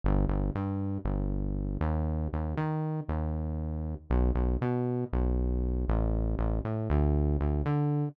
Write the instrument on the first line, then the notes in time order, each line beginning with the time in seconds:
synth bass 1
0.04 G1
0.29 G1
0.55 G2
1.05 G1
1.81 D#2
2.33 D#2
2.57 D#3
3.08 D#2
4.10 B1
4.35 B1
4.61 B2
5.13 B1
5.88 A1
6.39 A1
6.65 A2
6.90 D2
7.41 D2
7.66 D3